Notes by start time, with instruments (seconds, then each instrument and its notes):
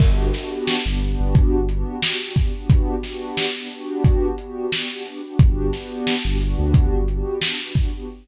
0.00 synth bass 2 G1, pad 2 (warm) B3 D4 F#4 G4, kick, crash
0.34 pad 2 (warm) B3 D4 F#4 G4, snare, closed hi-hat
0.67 snare
0.86 synth bass 2 G1, pad 2 (warm) B3 D4 F#4 G4
1.01 pad 2 (warm) B3 D4 F#4 G4, closed hi-hat
1.20 synth bass 2 G1
1.35 kick, closed hi-hat
1.54 synth bass 2 G1
1.68 pad 2 (warm) B3 D4 F#4 G4, closed hi-hat
2.02 pad 2 (warm) B3 D4 F#4 G4, snare
2.21 pad 2 (warm) B3 D4 F#4 G4
2.36 pad 2 (warm) B3 D4 F#4 G4, kick, closed hi-hat
2.54 pad 2 (warm) B3 D4 F#4 G4
2.70 kick, closed hi-hat
3.03 pad 2 (warm) B3 D4 F#4 G4, snare, closed hi-hat
3.37 snare
3.55 pad 2 (warm) B3 D4 F#4 G4
3.71 pad 2 (warm) B3 D4 F#4 G4, closed hi-hat
4.04 kick, closed hi-hat
4.38 pad 2 (warm) B3 D4 F#4 G4, closed hi-hat
4.72 pad 2 (warm) B3 D4 F#4 G4, snare
4.91 pad 2 (warm) B3 D4 F#4 G4
5.05 pad 2 (warm) B3 D4 F#4 G4, closed hi-hat
5.24 pad 2 (warm) B3 D4 F#4 G4
5.39 synth bass 2 G1, pad 2 (warm) B3 D4 F#4 G4, kick, closed hi-hat
5.73 pad 2 (warm) B3 D4 F#4 G4, snare, closed hi-hat
6.07 snare
6.25 synth bass 2 G1, pad 2 (warm) B3 D4 F#4 G4
6.40 pad 2 (warm) B3 D4 F#4 G4, closed hi-hat
6.59 synth bass 2 D2
6.74 kick, closed hi-hat
6.92 synth bass 2 G1
7.08 pad 2 (warm) B3 D4 F#4 G4, closed hi-hat
7.41 pad 2 (warm) B3 D4 F#4 G4, snare
7.60 pad 2 (warm) B3 D4 F#4 G4
7.75 pad 2 (warm) B3 D4 F#4 G4, kick, closed hi-hat
7.94 pad 2 (warm) B3 D4 F#4 G4